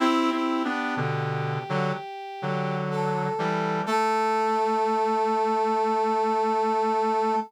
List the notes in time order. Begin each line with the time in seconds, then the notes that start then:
0.00 C4 E4 G4
0.32 C4 E4
0.65 B3 D4
0.97 B2 D3
1.69 D3 F#3
2.42 D3 F#3
2.91 A4
3.39 E3 G3
3.86 A3 A4